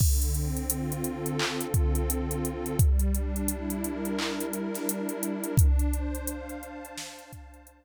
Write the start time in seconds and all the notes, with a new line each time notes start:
0.00 D3, kick, crash
0.22 closed hi-hat
0.34 C4, closed hi-hat
0.57 closed hi-hat
0.70 F4, closed hi-hat
0.92 closed hi-hat
1.04 A4, closed hi-hat
1.26 closed hi-hat
1.39 D3, clap
1.61 closed hi-hat
1.74 C4, kick, closed hi-hat
1.95 closed hi-hat
2.09 F4, closed hi-hat
2.31 closed hi-hat
2.44 A4, closed hi-hat
2.66 closed hi-hat
2.78 G3, kick, closed hi-hat
2.99 closed hi-hat
3.14 D4, closed hi-hat
3.36 closed hi-hat
3.48 E4, closed hi-hat
3.70 closed hi-hat
3.84 A#4, closed hi-hat
4.05 closed hi-hat
4.19 G3, clap
4.41 closed hi-hat
4.53 D4, closed hi-hat
4.74 snare, closed hi-hat
4.88 E4, closed hi-hat
5.09 closed hi-hat
5.23 A#4, closed hi-hat
5.44 closed hi-hat
5.57 D4, kick, closed hi-hat
5.79 closed hi-hat
5.93 C5, closed hi-hat
6.15 closed hi-hat
6.27 F5, closed hi-hat
6.49 closed hi-hat
6.62 A5, closed hi-hat
6.85 closed hi-hat
6.97 D4, snare
7.19 closed hi-hat
7.32 C5, kick, closed hi-hat
7.54 closed hi-hat
7.67 F5, closed hi-hat